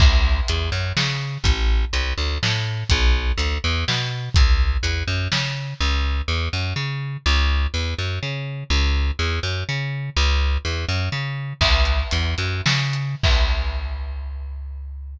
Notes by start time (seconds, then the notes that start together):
0.00 C#2, kick, crash
0.48 E2, closed hi-hat
0.72 F#2
0.97 C#3, snare
1.44 A1, kick, closed hi-hat
1.93 C2, closed hi-hat
2.18 D2
2.43 A2, snare
2.89 B1, kick, closed hi-hat
3.38 D2, closed hi-hat
3.64 E2
3.88 B2, snare
4.34 C#2, kick, closed hi-hat
4.83 E2, closed hi-hat
5.08 F#2
5.32 C#3, snare
5.80 C#2
6.28 E2
6.53 F#2
6.76 C#3
7.26 C#2
7.74 E2
7.98 F#2
8.23 C#3
8.70 C#2
9.19 E2
9.43 F#2
9.69 C#3
10.17 C#2
10.65 E2
10.89 F#2
11.12 C#3
11.61 C#2, kick, crash
11.85 closed hi-hat
12.11 E2, closed hi-hat
12.38 F#2, closed hi-hat
12.66 C#3, snare
12.93 closed hi-hat
13.23 C#2, kick, crash